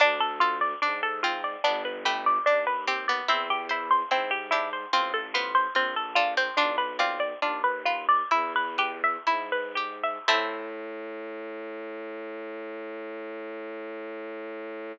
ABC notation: X:1
M:4/4
L:1/16
Q:1/4=73
K:Am
V:1 name="Harpsichord"
D A F d D A F d D B G d D B G d | C G E c C G E c C A F c C A F c | "^rit." D B F d D B F d E B G e E B G e | a16 |]
V:2 name="Harpsichord"
D6 C2 B,2 A,2 z2 C B, | E6 D2 C2 B,2 z2 D C | "^rit." D2 C6 z8 | A,16 |]
V:3 name="Harpsichord"
D2 A2 D2 F2 D2 B2 D2 G2 | E2 c2 E2 G2 F2 c2 F2 A2 | "^rit." F2 d2 F2 B2 E2 B2 E2 G2 | [CEA]16 |]
V:4 name="Violin" clef=bass
D,,4 ^G,,4 =G,,,4 _E,,4 | E,,4 ^G,,4 A,,,4 _B,,,4 | "^rit." B,,,4 _E,,4 =E,,4 ^G,,4 | A,,16 |]